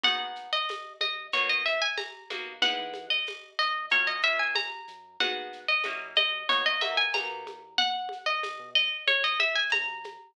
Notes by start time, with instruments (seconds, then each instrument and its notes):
0.03 synth bass 1 G#1, acoustic guitar (steel) B3 D#4 F#4 G#4 F#5, low conga, shaker
0.20 synth bass 1 G#1
0.35 shaker
0.53 acoustic guitar (steel) D#5
0.69 tambourine, high conga, shaker
1.01 synth bass 1 G#1, acoustic guitar (steel) D#5, high conga, shaker
1.32 synth bass 1 B1, acoustic guitar (steel) A#3 B3 D#4 F#4 C#5, low conga, shaker
1.49 synth bass 1 F#2, acoustic guitar (steel) D#5
1.66 acoustic guitar (steel) E5, shaker
1.82 acoustic guitar (steel) G#5
1.97 acoustic guitar (steel) A#5, tambourine, high conga, shaker
2.30 synth bass 1 B1, acoustic guitar (steel) A#3 B3 D#4 F#4, high conga, shaker
2.62 synth bass 1 E2, acoustic guitar (steel) G#3 B3 D#4 E4 F#5, low conga, shaker
2.78 synth bass 1 E3
2.94 high conga, shaker
3.10 acoustic guitar (steel) D#5
3.26 tambourine, high conga, shaker
3.59 synth bass 1 E2, acoustic guitar (steel) D#5, shaker
3.90 synth bass 1 F#2, acoustic guitar (steel) F#3 A#3 C#4 F4 C#5, low conga, shaker
4.07 synth bass 1 F#2, acoustic guitar (steel) D#5
4.22 acoustic guitar (steel) F#3 A#3 C#4 F4 E5, shaker
4.39 acoustic guitar (steel) G#5
4.55 acoustic guitar (steel) A#5, tambourine, high conga, shaker
4.87 synth bass 1 F#2, shaker
5.20 synth bass 1 G#1, acoustic guitar (steel) B3 D#4 F#4 G#4 F#5, low conga, shaker
5.53 shaker
5.68 acoustic guitar (steel) D#5
5.83 synth bass 1 F#2, acoustic guitar (steel) A#3 C#4 E4 F#4, tambourine, high conga, shaker
6.15 acoustic guitar (steel) D#5, high conga, shaker
6.49 synth bass 1 B1, acoustic guitar (steel) A#3 B3 D#4 F#4 C#5, low conga, shaker
6.66 acoustic guitar (steel) D#5
6.80 acoustic guitar (steel) A#3 B3 D#4 F#4 E5, high conga, shaker
6.97 acoustic guitar (steel) G#5
7.14 synth bass 1 B1, acoustic guitar (steel) A#3 B3 D#4 F#4 A#5, tambourine, high conga, shaker
7.30 synth bass 1 B2
7.46 synth bass 1 E2, high conga, shaker
7.78 acoustic guitar (steel) F#5, low conga, shaker
8.09 high conga, shaker
8.26 acoustic guitar (steel) D#5
8.43 synth bass 1 E2, tambourine, high conga, shaker
8.59 synth bass 1 B2
8.75 acoustic guitar (steel) D#5, shaker
9.07 synth bass 1 F#2, acoustic guitar (steel) C#5, high conga, shaker
9.24 acoustic guitar (steel) D#5
9.40 acoustic guitar (steel) E5, high conga, shaker
9.55 acoustic guitar (steel) G#5
9.70 synth bass 1 C#3, acoustic guitar (steel) A#5, tambourine, high conga, shaker
9.88 synth bass 1 F#2
10.04 high conga, shaker